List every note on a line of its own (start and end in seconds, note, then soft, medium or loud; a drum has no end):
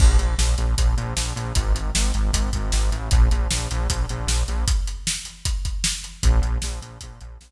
0.00 0.17 A#1 loud
0.00 kick loud
0.00 crash loud
0.18 0.35 A#1 medium
0.18 closed hi-hat medium
0.38 0.55 A#1 medium
0.38 snare loud
0.58 0.75 A#1 medium
0.58 closed hi-hat medium
0.78 0.95 A#1 medium
0.78 kick medium
0.78 closed hi-hat loud
0.97 1.14 A#1 medium
0.97 closed hi-hat medium
1.16 1.33 A#1 medium
1.16 snare loud
1.36 1.53 A#1 medium
1.36 closed hi-hat medium
1.55 1.73 G#1 medium
1.55 kick loud
1.55 closed hi-hat loud
1.74 1.91 G#1 medium
1.74 closed hi-hat medium
1.95 2.12 G#1 medium
1.95 snare loud
2.14 2.31 G#1 medium
2.14 closed hi-hat medium
2.33 2.50 G#1 medium
2.33 kick medium
2.33 closed hi-hat loud
2.53 2.72 G#1 medium
2.53 kick medium
2.53 closed hi-hat medium
2.72 2.90 G#1 medium
2.72 snare loud
2.92 3.09 A1 medium
2.92 closed hi-hat medium
3.11 3.29 A#1 loud
3.11 kick loud
3.11 closed hi-hat loud
3.31 3.48 A#1 medium
3.31 closed hi-hat medium
3.51 3.68 A#1 medium
3.51 snare loud
3.71 3.88 A#1 medium
3.71 closed hi-hat medium
3.89 4.06 A#1 medium
3.89 kick medium
3.89 closed hi-hat loud
4.09 4.26 A#1 medium
4.09 closed hi-hat medium
4.27 4.44 A#1 medium
4.27 snare loud
4.48 4.65 A#1 medium
4.48 closed hi-hat medium
4.68 kick loud
4.68 closed hi-hat loud
4.87 closed hi-hat medium
5.07 snare loud
5.25 closed hi-hat medium
5.45 kick medium
5.45 closed hi-hat loud
5.65 kick medium
5.65 closed hi-hat medium
5.84 snare loud
6.04 closed hi-hat medium
6.23 6.41 A#1 loud
6.23 kick loud
6.23 closed hi-hat loud
6.42 6.58 A#1 medium
6.42 closed hi-hat medium
6.62 6.80 A#1 medium
6.62 snare loud
6.82 6.98 A#1 medium
6.82 closed hi-hat medium
7.01 7.20 A#1 medium
7.01 kick medium
7.01 closed hi-hat loud
7.21 7.38 A#1 medium
7.21 closed hi-hat medium
7.41 7.51 A#1 medium
7.41 snare loud